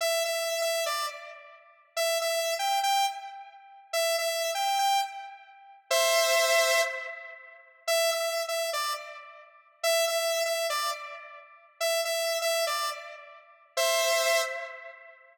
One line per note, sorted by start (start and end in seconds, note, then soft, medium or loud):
0.01 0.23 E5 loud
0.25 0.61 E5 medium
0.62 0.85 E5 medium
0.86 1.06 D5 medium
1.97 2.18 E5 loud
2.21 2.54 E5 medium
2.59 2.80 G5 medium
2.83 3.06 G5 loud
3.93 4.16 E5 loud
4.18 4.51 E5 medium
4.55 4.78 G5 medium
4.79 5.01 G5 medium
5.90 6.81 C5 loud
5.90 6.81 E5 loud
7.87 8.10 E5 loud
8.11 8.43 E5 medium
8.48 8.70 E5 medium
8.73 8.93 D5 medium
9.83 10.05 E5 loud
10.08 10.43 E5 loud
10.45 10.67 E5 medium
10.70 10.90 D5 loud
11.80 12.01 E5 loud
12.05 12.39 E5 medium
12.42 12.65 E5 loud
12.67 12.90 D5 medium
13.77 14.42 C5 loud
13.77 14.42 E5 loud